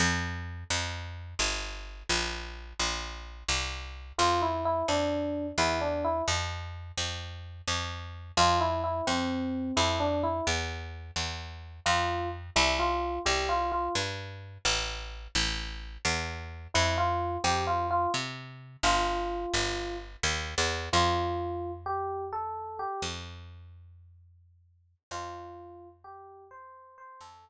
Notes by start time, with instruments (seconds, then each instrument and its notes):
0.00 electric bass (finger) F2
0.70 electric bass (finger) F2
1.39 electric bass (finger) G1
2.09 electric bass (finger) A#1
2.79 electric bass (finger) A#1
3.48 electric bass (finger) C2
4.18 electric bass (finger) F2, electric piano 1 F4
4.42 electric piano 1 E4
4.65 electric piano 1 E4
4.88 electric bass (finger) F2, electric piano 1 D4
5.58 electric bass (finger) E2, electric piano 1 E4
5.81 electric piano 1 D4
6.04 electric piano 1 E4
6.28 electric bass (finger) F2
6.97 electric bass (finger) F2
7.68 electric bass (finger) F2
8.37 electric bass (finger) F2, electric piano 1 F4
8.60 electric piano 1 E4
8.84 electric piano 1 E4
9.07 electric bass (finger) F2, electric piano 1 C4
9.77 electric bass (finger) F2, electric piano 1 E4
10.00 electric piano 1 D4
10.23 electric piano 1 E4
10.47 electric bass (finger) E2
11.16 electric bass (finger) E2
11.86 electric bass (finger) F2, electric piano 1 F4
12.56 electric bass (finger) C2, electric piano 1 E4
12.79 electric piano 1 F4
13.26 electric bass (finger) C2, electric piano 1 G4
13.49 electric piano 1 F4
13.72 electric piano 1 F4
13.95 electric bass (finger) G2
14.65 electric bass (finger) A1
15.35 electric bass (finger) A1
16.05 electric bass (finger) E2
16.74 electric bass (finger) F2, electric piano 1 E4
16.98 electric piano 1 F4
17.44 electric bass (finger) F2, electric piano 1 G4
17.67 electric piano 1 F4
17.91 electric piano 1 F4
18.14 electric bass (finger) C3
18.83 electric bass (finger) G1, electric piano 1 F4
19.54 electric bass (finger) G1
20.23 electric bass (finger) D#2
20.58 electric bass (finger) E2
20.93 electric bass (finger) F2, electric piano 1 F4
21.86 electric piano 1 G4
22.33 electric piano 1 A4
22.79 electric piano 1 G4
23.02 electric bass (finger) F2
25.11 electric bass (finger) F2, electric piano 1 F4
26.04 electric piano 1 G4
26.51 electric piano 1 C5
26.98 electric piano 1 C5
27.21 electric bass (finger) F2, electric piano 1 A4